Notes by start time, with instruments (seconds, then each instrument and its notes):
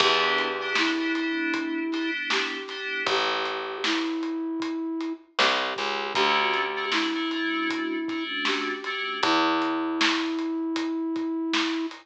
0.00 electric bass (finger) E2, electric piano 2 B3 D4 E4 G4, flute G4, kick, crash
0.38 closed hi-hat
0.61 electric piano 2 B3 D4 E4 G4
0.75 flute E4, snare
0.99 electric piano 2 B3 D4 E4 G4
1.15 electric piano 2 B3 D4 E4 G4, closed hi-hat
1.54 kick, closed hi-hat
1.92 electric piano 2 B3 D4 E4 G4, snare, closed hi-hat
2.30 flute G4, snare
2.68 electric piano 2 B3 D4 E4 G4, snare, closed hi-hat
3.06 electric bass (finger) A1, flute G4, kick, closed hi-hat
3.45 closed hi-hat
3.84 flute E4, snare
4.23 closed hi-hat
4.60 kick, closed hi-hat
5.00 closed hi-hat
5.39 electric bass (finger) C2, flute G4, snare
5.76 electric bass (finger) C#2, kick, closed hi-hat
6.15 electric bass (finger) D2, electric piano 2 A3 C#4 D4 F#4, flute G4, kick, closed hi-hat
6.54 closed hi-hat
6.76 electric piano 2 A3 C#4 D4 F#4
6.92 flute E4, snare
7.15 electric piano 2 A3 C#4 D4 F#4
7.31 electric piano 2 A3 C#4 D4 F#4, closed hi-hat
7.70 kick, closed hi-hat
8.08 electric piano 2 A3 C#4 D4 F#4, kick, closed hi-hat
8.45 flute G4, snare
8.84 electric piano 2 A3 C#4 D4 F#4, closed hi-hat
9.23 electric bass (finger) E2, flute E4, kick, closed hi-hat
9.62 closed hi-hat
10.01 snare
10.38 closed hi-hat
10.76 kick, closed hi-hat
11.16 kick, closed hi-hat
11.53 snare
11.91 closed hi-hat